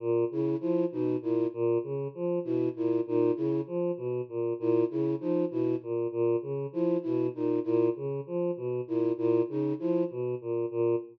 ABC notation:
X:1
M:3/4
L:1/8
Q:1/4=98
K:none
V:1 name="Choir Aahs" clef=bass
_B,, _D, F, =B,, _B,, B,, | _D, F, B,, _B,, B,, D, | F, B,, _B,, B,, _D, F, | B,, _B,, B,, _D, F, =B,, |
_B,, B,, _D, F, =B,, _B,, | _B,, _D, F, =B,, _B,, B,, |]
V:2 name="Flute"
z E E _E =E z | z2 E E _E =E | z3 E E _E | E z3 E E |
_E =E z3 E | E _E =E z3 |]